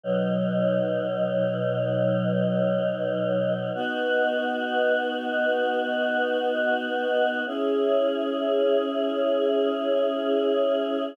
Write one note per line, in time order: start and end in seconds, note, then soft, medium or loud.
0.04 3.71 B2 medium
0.04 3.71 F#3 medium
0.04 3.71 D#4 medium
3.75 7.42 B3 loud
3.75 7.42 D#4 medium
3.75 7.42 F#4 medium
7.46 11.13 C#4 medium
7.46 11.13 E4 loud
7.46 11.13 G#4 medium